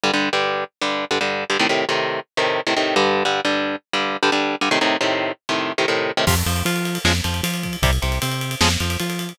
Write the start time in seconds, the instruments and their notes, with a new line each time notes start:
0.03 overdriven guitar G2 D3 G3
0.13 overdriven guitar G2 D3 G3
0.33 overdriven guitar G2 D3 G3
0.81 overdriven guitar G2 D3 G3
1.11 overdriven guitar G2 D3 G3
1.21 overdriven guitar G2 D3 G3
1.50 overdriven guitar G2 D3 G3
1.59 overdriven guitar A2 C3 D#3
1.69 overdriven guitar A2 C3 D#3
1.89 overdriven guitar A2 C3 D#3
2.37 overdriven guitar A2 C3 D#3
2.67 overdriven guitar A2 C3 D#3
2.76 overdriven guitar A2 C3 D#3
2.96 overdriven guitar G2 D3 G3
3.25 overdriven guitar G2 D3 G3
3.45 overdriven guitar G2 D3 G3
3.93 overdriven guitar G2 D3 G3
4.23 overdriven guitar G2 D3 G3
4.32 overdriven guitar G2 D3 G3
4.61 overdriven guitar G2 D3 G3
4.71 overdriven guitar A2 C3 D#3
4.81 overdriven guitar A2 C3 D#3
5.01 overdriven guitar A2 C3 D#3
5.49 overdriven guitar A2 C3 D#3
5.78 overdriven guitar A2 C3 D#3
5.88 overdriven guitar A2 C3 D#3
6.17 overdriven guitar A2 C3 D#3
6.27 synth bass 1 F2, overdriven guitar C3 F3, kick, crash
6.37 ride
6.46 synth bass 1 F2, overdriven guitar F3, ride
6.56 ride
6.65 synth bass 1 F3, overdriven guitar F4, ride
6.76 ride
6.85 ride
6.95 ride
7.04 synth bass 1 F2, overdriven guitar C#3 F3 G#3, snare
7.15 ride
7.24 synth bass 1 F2, overdriven guitar F3, ride
7.34 ride
7.43 synth bass 1 F3, overdriven guitar F4, ride
7.54 ride
7.63 kick, ride
7.73 ride
7.82 synth bass 1 C2, overdriven guitar C3 G3, kick, ride
7.93 ride
8.02 synth bass 1 C2, overdriven guitar C3, ride
8.12 ride
8.22 synth bass 1 C3, overdriven guitar C4, ride
8.32 ride
8.41 ride
8.51 ride
8.61 synth bass 1 F2, overdriven guitar C#3 F3 G#3, snare
8.71 ride
8.80 synth bass 1 F2, overdriven guitar F3, ride
8.90 ride
9.00 synth bass 1 F3, overdriven guitar F4, ride
9.10 ride
9.19 ride
9.29 ride